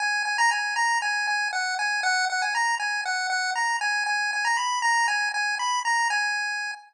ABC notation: X:1
M:4/4
L:1/16
Q:1/4=118
K:G#m
V:1 name="Lead 1 (square)"
g2 g a g2 a2 g2 g2 f2 g2 | f2 f g a2 g2 f2 f2 a2 g2 | g2 g a b2 a2 g2 g2 b2 a2 | g6 z10 |]